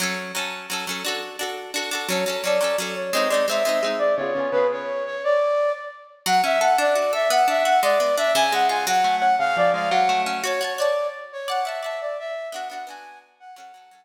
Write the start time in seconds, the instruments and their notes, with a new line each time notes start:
0.00 orchestral harp F#3 C#4 A4
0.35 orchestral harp F#3 C#4 A4
0.70 orchestral harp F#3 C#4 A4
0.87 orchestral harp F#3 C#4 A4
1.05 orchestral harp D4 F#4 A4
1.39 orchestral harp D4 F#4 A4
1.74 orchestral harp D4 F#4 A4
1.91 orchestral harp D4 F#4 A4
2.08 orchestral harp F#3 C#4 A4, flute C#5
2.26 orchestral harp F#3 C#4 A4, flute C#5
2.44 orchestral harp F#3 C#4 A4, flute D5
2.61 orchestral harp F#3 C#4 A4
2.78 orchestral harp F#3 C#4 A4
2.96 flute C#5
3.13 orchestral harp G#3 C4 D#4, flute D#5
3.29 orchestral harp G#3 C4, flute D5
3.34 orchestral harp D#4
3.48 orchestral harp G#3 C4 D#4, flute E5
3.65 orchestral harp G#3 C4 D#4
3.83 orchestral harp G#3 C4 D#4
3.98 flute D5
4.16 orchestral harp C#3 B3, flute C#5
4.21 orchestral harp F4 G#4
4.35 orchestral harp C#3 B3 F4
4.40 orchestral harp G#4
4.52 orchestral harp C#3 B3 F4, flute B4
4.57 orchestral harp G#4
4.72 flute C#5
5.06 flute C#5
5.24 flute D5
6.26 orchestral harp F#3, flute F#5
6.44 orchestral harp C#4, flute E5
6.61 orchestral harp A4, flute F#5
6.78 orchestral harp D4, flute D5
6.95 orchestral harp F#4
7.13 orchestral harp A4, flute E5
7.30 orchestral harp B3, flute F#5
7.48 orchestral harp D4, flute E5
7.65 orchestral harp F#4, flute F#5
7.82 orchestral harp G#3, flute D5
8.00 orchestral harp B3
8.17 orchestral harp D4, flute E5
8.35 orchestral harp C#3, flute G#5
8.52 orchestral harp G#3, flute F#5
8.69 orchestral harp F4, flute G#5
8.87 orchestral harp F#3, flute F#5
9.04 orchestral harp A3
9.20 orchestral harp C#4, flute F#5
9.39 orchestral harp C#3, flute F5
9.57 orchestral harp F3, flute D5
9.74 orchestral harp G#3, flute F5
9.91 orchestral harp F#3, flute F#5
10.09 orchestral harp A3
10.26 orchestral harp C#4
10.44 orchestral harp F#4 C#5 A5, flute C#5
10.61 orchestral harp F#4 C#5 A5, flute C#5
10.78 orchestral harp F#4 C#5 A5, flute D5
11.33 flute C#5
11.48 orchestral harp D5 F#5 A5, flute F#5
11.64 orchestral harp D5 F#5, flute E5
11.69 orchestral harp A5
11.82 orchestral harp D5 F#5, flute E5
11.86 orchestral harp A5
12.01 flute D5
12.19 flute E5
12.52 orchestral harp B3 D4 F#4, flute F#5
12.68 orchestral harp B3 D4, flute F#5
12.73 orchestral harp F#4
12.87 orchestral harp B3 D4 F#4, flute G#5
13.40 flute F#5
13.56 orchestral harp F#3 C#4, flute F#5
13.60 orchestral harp A4
13.74 orchestral harp F#3 C#4 A4
13.91 orchestral harp F#3 C#4 A4